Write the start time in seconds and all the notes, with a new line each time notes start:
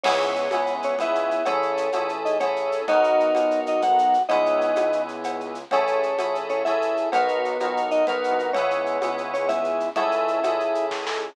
0.03 C#2 B3 C#4 E4 G#4 C#5, crash, cowbell, low conga, shaker
0.21 shaker
0.36 shaker
0.51 C#2 B3 C#4 E4 G#4, cowbell, high conga, shaker
0.66 shaker
0.83 C#4 C#5, shaker
0.99 B3 C#4 E4 G#4 E5, cowbell, low conga, shaker
1.15 shaker
1.31 shaker
1.45 A1 C#4 E4 G#4 A4 C#5, cowbell, low conga, shaker
1.62 shaker
1.77 shaker
1.92 A1 C#4 E4 G#4 A4, cowbell, high conga, shaker
2.09 shaker
2.25 D#4 D#5, shaker
2.40 C#4 E4 G#4 A4 C#5, cowbell, low conga, shaker
2.56 shaker
2.72 shaker
2.88 B1 B3 D#4 F#4 A#4 D#5, cowbell, low conga, shaker
3.04 shaker
3.20 shaker
3.35 B1, cowbell, high conga, shaker
3.51 shaker
3.66 D#4 D#5, shaker
3.82 F#4 F#5, cowbell, low conga, shaker
3.98 shaker
4.14 shaker
4.29 C#2 B3 C#4 D#4 E4 G#4 D#5, cowbell, low conga, shaker
4.46 shaker
4.61 shaker
4.76 C#2, cowbell, high conga, shaker
4.93 shaker
5.08 shaker
5.24 cowbell, shaker
5.40 shaker
5.55 shaker
5.71 A1 C#4 E4 G#4 A4 C#5, cowbell, low conga, shaker
5.87 shaker
6.03 shaker
6.18 A1 C#4 E4 G#4 A4, cowbell, high conga, shaker
6.35 shaker
6.49 C#4 C#5, shaker
6.65 C#4 E4 G#4 A4 E5, cowbell, low conga, shaker
6.82 shaker
6.97 shaker
7.12 B1 B3 D#4 F#4 A#4 B4, cowbell, low conga, shaker
7.28 shaker
7.45 shaker
7.60 B1 B3 D#4 F#4 A#4, cowbell, high conga, shaker
7.77 shaker
7.91 D#4 D#5, shaker
8.07 B1 B3 D#4 F#4 A#4 B4, cowbell, low conga, shaker
8.24 shaker
8.31 C2
8.39 shaker
8.53 C#2 B3 C#4 E4 G#4 C#5, cowbell, low conga, shaker
8.71 shaker
8.86 shaker
9.01 C#2 B3 C#4 E4 G#4, cowbell, high conga, shaker
9.18 shaker
9.34 C#4 C#5, shaker
9.49 E4 E5, cowbell, low conga, shaker
9.64 shaker
9.80 shaker
9.95 C#2 C#4 E4 G#4 A4 E5, cowbell, low conga, shaker
10.11 shaker
10.28 shaker
10.43 C#2 C#4 E4 G#4 A4, cowbell, high conga, shaker
10.60 shaker
10.75 shaker
10.91 kick, snare
11.07 snare